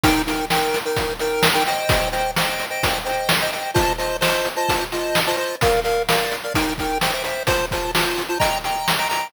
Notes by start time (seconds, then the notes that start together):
0.03 D#4 A#4 G5, kick, closed hi-hat
0.27 D#4 A#4 G5, closed hi-hat
0.50 D#4 A#4 G5, snare
0.74 closed hi-hat
0.85 D#4 A#4 G5
0.97 kick, closed hi-hat
1.19 D#4 A#4 G5, closed hi-hat
1.43 snare
1.54 D#4 A#4 G5
1.66 C5 D#5 G5, closed hi-hat
1.89 kick, closed hi-hat
2.12 C5 D#5 G5, closed hi-hat
2.36 C5 D#5 G5, snare
2.59 closed hi-hat
2.70 C5 D#5 G5
2.83 kick, closed hi-hat
3.05 C5 D#5 G5, closed hi-hat
3.29 snare
3.42 C5 D#5 G5
3.52 C5 D#5 G5, closed hi-hat
3.74 F4 C5 D#5 A5, kick, closed hi-hat
3.98 F4 C5 D#5 A5, closed hi-hat
4.21 F4 C5 D#5 A5, snare
4.45 closed hi-hat
4.56 F4 C5 D#5 A5
4.69 kick, closed hi-hat
4.92 F4 C5 D#5 A5, closed hi-hat
5.15 snare
5.27 F4 C5 D#5 A5
5.37 F4 C5 D#5 A5
5.61 A#4 D5 F5, kick, closed hi-hat
5.84 A#4 D5 F5, closed hi-hat
6.08 A#4 D5 F5, snare
6.31 closed hi-hat
6.44 A#4 D5 F5
6.54 D#4 A#4 G5, kick, closed hi-hat
6.78 D#4 A#4 G5, kick, closed hi-hat
7.01 C5 E5 G5, snare
7.13 C5 E5 G5
7.24 C5 E5 G5, closed hi-hat
7.47 F4 C5 A5, kick, closed hi-hat
7.71 F4 C5 A5, kick, closed hi-hat
7.95 F4 C5 A5, snare
8.17 closed hi-hat
8.29 F4 C5 A5
8.40 D#5 G5 A#5, kick, closed hi-hat
8.64 D#5 G5 A#5, closed hi-hat
8.88 snare
8.98 D#5 G5 A#5
9.09 D#5 G5 A#5, closed hi-hat